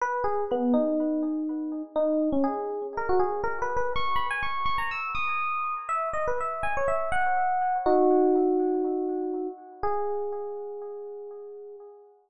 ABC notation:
X:1
M:4/4
L:1/16
Q:1/4=122
K:G#m
V:1 name="Electric Piano 1"
B2 G2 B,2 D10 | D3 C G4 A F G2 (3A2 B2 B2 | c'2 b g c'2 c' a e'2 d'6 | e2 d B e2 g c e2 f6 |
[DF]14 z2 | G16 |]